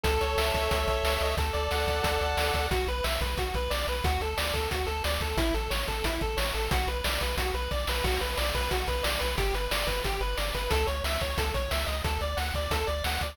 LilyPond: <<
  \new Staff \with { instrumentName = "Lead 1 (square)" } { \time 4/4 \key b \minor \tempo 4 = 180 a'8 cis''8 e''8 cis''8 a'8 cis''8 e''8 dis''8 | a'8 d''8 fis''8 d''8 a'8 d''8 fis''8 d''8 | fis'8 b'8 e''8 b'8 fis'8 b'8 d''8 b'8 | fis'8 a'8 d''8 a'8 fis'8 a'8 d''8 a'8 |
e'8 a'8 cis''8 a'8 e'8 a'8 cis''8 a'8 | fis'8 b'8 d''8 b'8 fis'8 b'8 d''8 b'8 | fis'8 b'8 d''8 b'8 fis'8 b'8 d''8 b'8 | g'8 b'8 d''8 b'8 g'8 b'8 d''8 b'8 |
a'8 cis''8 e''8 cis''8 a'8 cis''8 e''8 dis''8 | a'8 d''8 fis''8 d''8 a'8 d''8 fis''8 d''8 | }
  \new Staff \with { instrumentName = "Synth Bass 1" } { \clef bass \time 4/4 \key b \minor cis,8 cis,8 cis,8 cis,8 cis,8 b,,8 cis,8 cis,8 | d,8 d,8 d,8 d,8 d,8 d,8 d,8 d,8 | b,,8 b,,8 b,,8 b,,8 b,,8 b,,8 b,,8 b,,8 | d,8 d,8 d,8 d,8 d,8 d,8 d,8 d,8 |
a,,8 a,,8 a,,8 a,,8 a,,8 a,,8 a,,8 a,,8 | b,,8 b,,8 b,,8 b,,8 b,,8 b,,8 b,,8 b,,8 | b,,8 b,,8 b,,8 b,,8 b,,8 b,,8 b,,8 b,,8 | g,,8 g,,8 g,,8 g,,8 g,,8 g,,8 g,,8 g,,8 |
cis,8 cis,8 cis,8 cis,8 cis,8 b,,8 cis,8 cis,8 | d,8 d,8 d,8 d,8 d,8 d,8 d,8 d,8 | }
  \new DrumStaff \with { instrumentName = "Drums" } \drummode { \time 4/4 <hh bd>8 hh8 sn8 <hh bd>8 <hh bd>8 <hh bd>8 sn8 hh8 | <hh bd>8 hh8 sn8 <hh bd>8 <hh bd>8 hh8 sn8 <hh bd>8 | <hh bd>8 hh8 sn8 <hh bd>8 <hh bd>8 <hh bd>8 sn8 hh8 | <hh bd>8 hh8 sn8 <hh bd>8 <hh bd>8 hh8 sn8 <hh bd>8 |
<hh bd>8 hh8 sn8 <hh bd>8 <hh bd>8 <hh bd>8 sn8 hh8 | <hh bd>8 hh8 sn8 <hh bd>8 <hh bd>8 hh8 <bd sn>8 sn8 | <cymc bd>8 hh8 sn8 <hh bd>8 <hh bd>8 <hh bd>8 sn8 hh8 | <hh bd>8 hh8 sn8 <hh bd>8 <hh bd>8 hh8 sn8 <hh bd>8 |
<hh bd>8 hh8 sn8 <hh bd>8 <hh bd>8 <hh bd>8 sn8 hh8 | <hh bd>8 hh8 sn8 <hh bd>8 <hh bd>8 hh8 sn8 <hh bd>8 | }
>>